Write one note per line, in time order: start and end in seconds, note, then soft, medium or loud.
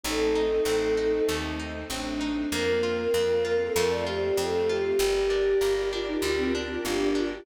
0.04 0.60 A1 medium
0.04 2.49 A3 medium
0.04 0.33 A3 medium
0.04 2.49 C4 medium
0.04 1.58 D#4 medium
0.04 2.49 D#4 medium
0.04 1.20 A4 loud
0.35 0.63 D#4 medium
0.65 1.21 A1 medium
0.65 0.94 C4 medium
0.97 1.25 D#4 medium
1.29 1.84 D#2 medium
1.29 1.57 A3 medium
1.60 1.87 D#4 medium
1.90 2.45 A1 medium
1.90 2.18 C4 medium
1.90 2.48 D4 medium
2.21 2.49 D#4 medium
2.52 3.08 F2 medium
2.52 3.74 A#3 medium
2.52 2.80 A#3 medium
2.52 3.02 A#3 medium
2.52 3.74 C4 medium
2.52 3.74 F4 medium
2.52 3.42 A#4 loud
2.83 3.11 F4 medium
3.14 3.70 F2 medium
3.14 3.42 C4 medium
3.45 3.73 F4 medium
3.45 3.59 A#4 loud
3.61 3.75 A4 medium
3.76 4.32 F2 medium
3.76 4.98 A3 medium
3.76 4.04 A3 medium
3.76 4.98 C4 medium
3.76 4.98 F4 medium
3.76 3.90 A#4 loud
3.90 4.05 D5 medium
4.07 4.35 F4 medium
4.07 4.37 G4 medium
4.37 4.93 F2 medium
4.37 4.65 C4 medium
4.37 4.65 A4 medium
4.69 4.97 F4 medium
4.69 4.84 G4 loud
4.84 4.99 G4 medium
4.98 5.55 G1 medium
4.98 5.27 G3 medium
4.98 7.19 G4 medium
4.98 7.43 G4 medium
4.98 5.81 G4 loud
4.98 7.43 A#4 medium
4.98 7.43 D5 medium
5.30 5.58 D4 medium
5.61 6.17 G1 medium
5.61 5.89 A#3 medium
5.93 6.20 D4 medium
5.93 6.08 F4 medium
6.06 6.21 D#4 medium
6.22 6.78 D2 medium
6.22 6.51 G3 medium
6.22 6.38 F4 medium
6.37 6.52 C4 loud
6.55 6.83 D4 medium
6.55 6.81 F4 medium
6.85 7.40 G1 medium
6.85 7.14 A#3 medium
6.85 7.10 D4 medium
7.15 7.43 D4 medium
7.15 7.32 F4 loud
7.31 7.45 G4 medium